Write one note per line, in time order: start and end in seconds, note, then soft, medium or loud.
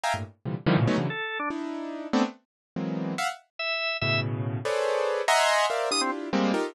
0.03 0.13 D#5 medium
0.03 0.13 E5 medium
0.03 0.13 F5 medium
0.03 0.13 G5 medium
0.03 0.13 G#5 medium
0.03 0.13 A#5 medium
0.14 0.23 G2 medium
0.14 0.23 A2 medium
0.14 0.23 A#2 medium
0.45 0.55 A#2 soft
0.45 0.55 C3 soft
0.45 0.55 D3 soft
0.45 0.55 E3 soft
0.45 0.55 F3 soft
0.45 0.55 G3 soft
0.66 0.76 D3 loud
0.66 0.76 D#3 loud
0.66 0.76 E3 loud
0.66 0.76 F3 loud
0.66 0.76 G3 loud
0.77 0.86 A2 medium
0.77 0.86 A#2 medium
0.77 0.86 B2 medium
0.77 0.86 C#3 medium
0.87 0.97 F#3 medium
0.87 0.97 G#3 medium
0.87 0.97 A3 medium
0.87 0.97 B3 medium
0.87 0.97 C#4 medium
0.87 0.97 D#4 medium
0.98 1.07 C#3 medium
0.98 1.07 D3 medium
0.98 1.07 E3 medium
0.98 1.07 F#3 medium
1.10 1.38 A4 medium
1.39 1.49 D4 medium
1.50 2.07 D4 medium
1.50 2.07 D#4 medium
1.50 2.07 E4 medium
2.13 2.23 A3 loud
2.13 2.23 B3 loud
2.13 2.23 C4 loud
2.13 2.23 D4 loud
2.76 3.14 E3 medium
2.76 3.14 F#3 medium
2.76 3.14 G#3 medium
2.76 3.14 A#3 medium
2.76 3.14 B3 medium
2.76 3.14 C4 medium
3.18 3.28 E5 medium
3.18 3.28 F5 medium
3.18 3.28 F#5 medium
3.59 3.97 E5 medium
4.01 4.59 A2 medium
4.01 4.59 B2 medium
4.01 4.59 C#3 medium
4.01 4.20 E5 medium
4.65 5.22 G#4 medium
4.65 5.22 A4 medium
4.65 5.22 B4 medium
4.65 5.22 C5 medium
4.65 5.22 C#5 medium
4.65 5.22 D5 medium
5.28 5.66 D#5 loud
5.28 5.66 E5 loud
5.28 5.66 F#5 loud
5.28 5.66 G#5 loud
5.28 5.66 A#5 loud
5.28 5.66 C6 loud
5.70 5.89 A#4 medium
5.70 5.89 C5 medium
5.70 5.89 D5 medium
5.70 5.89 E5 medium
5.70 5.89 F5 medium
5.91 6.29 D4 soft
5.91 6.29 E4 soft
5.91 6.29 F4 soft
5.91 6.29 G4 soft
5.91 6.01 D#6 loud
6.01 6.11 C4 medium
6.33 6.52 G3 medium
6.33 6.52 G#3 medium
6.33 6.52 A#3 medium
6.33 6.52 C4 medium
6.54 6.73 D#4 medium
6.54 6.73 F4 medium
6.54 6.73 G4 medium
6.54 6.73 A4 medium
6.54 6.73 A#4 medium